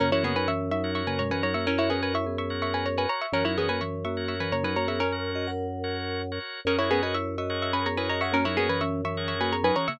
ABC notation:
X:1
M:7/8
L:1/16
Q:1/4=126
K:F#mix
V:1 name="Pizzicato Strings"
[CA] [Ec] [B,G] [Bg] [ec']2 [ec']2 [ec'] [Bg] [ca] [Bg] [ca] [ec'] | [CA] [Ec] [B,G] [Bg] [ec']2 [ec']2 [ec'] [Bg] [ca] [Bg] [ca] [ec'] | [CA] [Ec] [B,G] [Bg] [ec']2 [ec']2 [ec'] [Bg] [ca] [Bg] [ca] [ec'] | [CA]10 z4 |
[CA] [Ec] [B,G] [Bg] [ec']2 [ec']2 [ec'] [Bg] [ca] [Bg] [ca] [ec'] | [CA] [Ec] [B,G] [Bg] [ec']2 [ec']2 [ec'] [Bg] [ca] [Bg] [ca] [ec'] |]
V:2 name="Vibraphone"
[C,A,] [E,C] [C,A,] [F,D] [E,C]2 [F,D]3 [C,A,] [B,,G,] [E,C] [F,D] [A,F] | [Ec]2 [CA]2 [Ec] [B,G]7 z2 | [E,C] [F,D] [E,C] [A,F] [E,C]2 [A,F]3 [E,C] [C,A,] [F,D] [A,F] [B,G] | [CA]3 [Fd] [Af]8 z2 |
[CA] [Ec] [CA] [Fd] [Ec]2 [Fd]3 [CA] [B,G] [Ec] [Fd] [Af] | [A,F] [F,D] [A,F] [E,C] [E,C]2 [E,C]3 [A,F] [B,G] [F,D] [E,C] [C,A,] |]
V:3 name="Drawbar Organ"
[FAc] [FAc]6 [FAc]4 [FAc]3- | [FAc] [FAc]6 [FAc]4 [FAc]3 | [FAc] [FAc]6 [FAc]4 [FAc]3- | [FAc] [FAc]6 [FAc]4 [FAc]3 |
[FGAc] [FGAc]6 [FGAc]4 [FGAc]3- | [FGAc] [FGAc]6 [FGAc]4 [FGAc]3 |]
V:4 name="Drawbar Organ" clef=bass
F,,14- | F,,14 | F,,14- | F,,14 |
F,,14- | F,,14 |]